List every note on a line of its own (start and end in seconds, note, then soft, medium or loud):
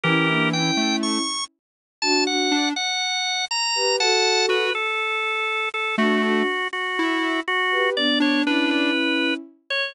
0.04 0.71 E3 medium
0.04 0.27 C#4 medium
0.04 0.27 E4 medium
0.04 0.49 G4 medium
0.04 0.49 A#4 medium
0.28 0.52 A#3 medium
0.28 0.52 D4 medium
0.53 1.21 C#4 medium
0.53 1.21 E4 medium
0.53 0.96 G5 medium
0.77 1.18 A3 medium
1.03 1.44 C#6 medium
2.02 2.26 D4 medium
2.02 2.26 F#4 medium
2.02 2.24 A5 loud
2.26 2.49 D4 medium
2.26 2.49 F#4 medium
2.26 2.69 F#5 medium
2.51 2.73 D4 medium
2.76 3.45 F#5 medium
3.51 3.96 A#5 medium
3.75 3.96 G4 medium
3.75 3.96 B4 medium
4.00 4.64 F#4 medium
4.00 4.64 A4 medium
4.00 4.46 F#5 medium
4.00 4.46 A5 medium
4.49 4.71 F#4 medium
4.49 4.73 B4 medium
4.75 5.69 A4 medium
5.74 5.96 A4 medium
5.98 6.43 A3 medium
5.98 6.19 D4 medium
5.98 6.19 F#4 medium
5.98 6.23 F#4 medium
6.23 6.46 D4 medium
6.23 6.46 F#4 medium
6.23 6.68 F#4 medium
6.73 7.40 F#4 medium
6.99 7.40 E4 medium
7.48 7.90 F#4 loud
7.71 7.94 G4 medium
7.71 7.94 B4 medium
7.97 8.40 B3 medium
7.97 8.40 D4 medium
7.97 8.19 D5 medium
8.20 8.44 D4 medium
8.20 8.42 C#5 medium
8.46 9.32 C#4 medium
8.46 8.91 D4 medium
8.46 9.32 E4 medium
8.46 8.70 B4 medium
8.71 9.34 B4 medium
9.70 9.93 C#5 medium